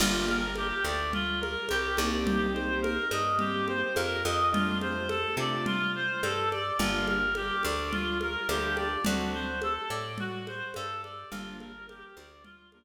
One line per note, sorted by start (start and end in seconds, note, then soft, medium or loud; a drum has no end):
0.00 0.73 G1 loud
0.00 0.39 A#3 medium
0.00 0.39 D4 medium
0.00 0.25 F4 medium
0.00 0.39 F4 medium
0.00 0.39 G4 medium
0.00 crash loud
0.00 low conga medium
0.28 0.54 A#4 medium
0.28 high conga medium
0.56 0.83 G4 medium
0.56 high conga medium
0.84 1.57 D2 medium
0.84 1.12 D5 medium
1.13 1.39 F4 medium
1.13 low conga medium
1.40 1.66 A#4 medium
1.40 high conga medium
1.69 1.98 C2 medium
1.69 1.96 G4 loud
1.69 high conga medium
1.97 2.99 C2 loud
1.97 2.46 A#3 medium
1.97 2.46 C4 medium
1.97 2.46 D#4 medium
1.97 2.46 G4 medium
1.97 2.25 D5 medium
1.97 high conga medium
2.25 2.51 G4 medium
2.25 low conga medium
2.53 2.94 A#3 medium
2.53 2.94 C4 medium
2.53 2.94 D#4 medium
2.53 2.94 G4 medium
2.53 2.79 C5 medium
2.53 high conga medium
2.82 3.08 A#4 medium
2.82 high conga medium
3.11 3.83 G2 medium
3.11 3.38 D#5 medium
3.11 high conga medium
3.39 3.79 A#3 medium
3.39 3.79 C4 medium
3.39 3.79 D#4 medium
3.39 3.65 G4 medium
3.39 3.79 G4 medium
3.39 low conga medium
3.67 3.93 C5 medium
3.67 high conga medium
3.96 4.23 F2 medium
3.96 4.22 A#4 medium
3.96 high conga medium
4.24 5.25 F2 medium
4.24 4.50 D#5 medium
4.24 high conga medium
4.52 4.93 A3 medium
4.52 4.93 C4 medium
4.52 4.93 D4 loud
4.52 4.78 F4 medium
4.52 4.93 F4 medium
4.52 low conga loud
4.81 5.08 C5 medium
4.81 high conga medium
5.09 5.35 A4 medium
5.09 high conga medium
5.37 6.09 C3 medium
5.37 5.77 A3 medium
5.37 5.77 C4 medium
5.37 5.77 D4 medium
5.37 5.77 F4 medium
5.37 5.65 D5 medium
5.66 5.92 F4 medium
5.66 low conga medium
5.95 6.21 C5 medium
6.23 6.71 G2 medium
6.23 6.49 A4 medium
6.23 high conga medium
6.51 6.77 D5 medium
6.51 high conga medium
6.79 7.51 G1 medium
6.79 7.19 G3 medium
6.79 7.19 A#3 medium
6.79 7.19 D4 medium
6.79 7.06 F4 medium
6.79 7.19 F4 medium
6.79 low conga medium
7.07 7.34 A#4 medium
7.07 high conga medium
7.35 7.62 G4 medium
7.35 high conga medium
7.63 8.37 D2 medium
7.63 7.90 D5 medium
7.63 high conga medium
7.92 8.18 F4 medium
7.92 low conga medium
8.21 8.48 A#4 medium
8.21 high conga medium
8.49 8.97 D2 medium
8.49 8.89 G3 medium
8.49 8.89 A#3 medium
8.49 8.89 D4 medium
8.49 8.89 F4 medium
8.49 8.76 G4 medium
8.49 high conga medium
8.77 9.03 D5 medium
8.77 high conga medium
9.05 9.78 D2 medium
9.05 9.45 F#3 medium
9.05 9.45 A3 medium
9.05 9.45 C4 medium
9.05 9.45 D4 medium
9.05 9.31 F#4 medium
9.05 low conga medium
9.33 9.59 C5 medium
9.62 9.89 A4 medium
9.62 high conga medium
9.90 10.62 A2 medium
9.90 10.16 D5 medium
10.18 10.45 F#4 loud
10.18 low conga medium
10.47 10.73 C5 medium
10.47 high conga medium
10.74 11.24 G2 medium
10.74 11.01 A4 loud
10.74 high conga medium
11.03 11.29 D5 medium
11.03 high conga medium
11.31 12.04 G1 medium
11.31 11.71 F3 medium
11.31 11.71 G3 medium
11.31 11.71 A#3 loud
11.31 11.71 D4 medium
11.31 11.57 F4 loud
11.31 low conga medium
11.60 11.86 A#4 medium
11.60 high conga medium
11.88 12.15 G4 medium
11.88 high conga medium
12.17 12.84 D2 medium
12.17 12.43 D5 medium
12.17 high conga medium
12.44 12.70 F4 loud
12.44 low conga medium
12.72 12.84 F3 medium
12.72 12.84 G3 medium
12.72 12.84 A#3 medium
12.72 12.84 D4 medium
12.72 12.84 A#4 medium
12.72 high conga medium